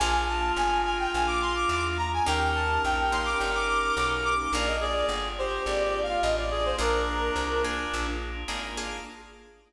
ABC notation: X:1
M:4/4
L:1/16
Q:1/4=106
K:Bb
V:1 name="Brass Section"
_a2 =a2 _a2 a g a d' c' d' d' z b a | g2 a2 g2 c' d' g d' d' d' d' z d' d' | d e d d z2 c2 (3d2 d2 f2 e d2 c | B6 z10 |]
V:2 name="Clarinet"
F16 | B16 | B2 _A4 G5 F3 A2 | D10 z6 |]
V:3 name="Acoustic Guitar (steel)"
[B,DF_A]16 | [B,_DEG]6 [B,DEG]10 | [B,DF_A]16 | [B,DF_A]6 [B,DFA]6 [B,DFA]2 [B,DFA]2 |]
V:4 name="Electric Bass (finger)" clef=bass
B,,,4 G,,,4 B,,,4 =E,,4 | E,,4 B,,,4 G,,,4 =B,,,4 | B,,,4 G,,,4 _A,,,4 =A,,,4 | B,,,4 C,,4 B,,,4 _A,,,4 |]
V:5 name="Drawbar Organ"
[B,DF_A]16 | [B,_DEG]16 | [B,DF_A]16 | [B,DF_A]16 |]